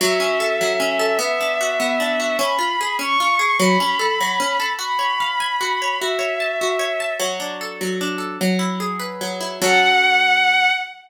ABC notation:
X:1
M:6/8
L:1/8
Q:3/8=100
K:F#m
V:1 name="Violin"
e6 | e6 | b3 c'3 | b6 |
b6 | e6 | z6 | z6 |
f6 |]
V:2 name="Orchestral Harp"
F, C A F, C A | B, D F B, D F | C ^E G C E G | F, C A F, C A |
F c ^e g F c | F c a F c a | F, D A F, D A | F, E G B F, E |
[F,CA]6 |]